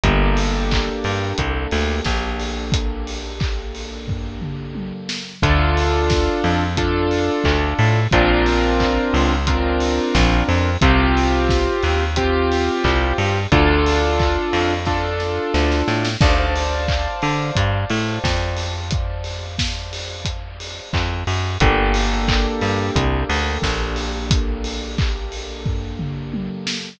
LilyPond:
<<
  \new Staff \with { instrumentName = "Acoustic Grand Piano" } { \time 4/4 \key d \minor \tempo 4 = 89 <bes d' g' a'>1~ | <bes d' g' a'>1 | <d' f' a'>2 <d' f' a'>2 | <c' d' f' bes'>2 <c' d' f' bes'>2 |
<c' f' g'>2 <c' f' g'>2 | <d' f' a'>2 <d' f' a'>2 | <c'' d'' f'' a''>1~ | <c'' d'' f'' a''>1 |
<bes d' g' a'>1~ | <bes d' g' a'>1 | }
  \new Staff \with { instrumentName = "Electric Bass (finger)" } { \clef bass \time 4/4 \key d \minor g,,4. g,8 c,8 d,8 bes,,4~ | bes,,1 | d,4. f,4. d,8 a,8 | bes,,4. cis,4. bes,,8 f,8 |
c,4. ees,4. c,8 g,8 | d,4. f,4. d,8 a,8 | d,4. d8 g,8 a,8 f,4~ | f,2. f,8 ges,8 |
g,,4. g,8 c,8 d,8 bes,,4~ | bes,,1 | }
  \new DrumStaff \with { instrumentName = "Drums" } \drummode { \time 4/4 <hh bd>8 hho8 <hc bd>8 hho8 <hh bd>8 hho8 <bd sn>8 hho8 | <hh bd>8 hho8 <hc bd>8 hho8 <bd tomfh>8 toml8 tommh8 sn8 | <hh bd>8 hho8 <bd sn>8 hho8 <hh bd>8 hho8 <hc bd>8 hho8 | <hh bd>8 hho8 <hc bd>8 hho8 <hh bd>8 hho8 <bd sn>8 hho8 |
<hh bd>8 hho8 <bd sn>8 hho8 <hh bd>8 hho8 <hc bd>8 hho8 | <hh bd>8 hho8 <hc bd>8 hho8 <bd sn>8 sn8 sn16 sn16 sn16 sn16 | <cymc bd>8 hho8 <hc bd>8 hho8 <hh bd>8 hho8 <bd sn>8 hho8 | <hh bd>8 hho8 <bd sn>8 hho8 <hh bd>8 hho8 <hc bd>8 hho8 |
<hh bd>8 hho8 <hc bd>8 hho8 <hh bd>8 hho8 <bd sn>8 hho8 | <hh bd>8 hho8 <hc bd>8 hho8 <bd tomfh>8 toml8 tommh8 sn8 | }
>>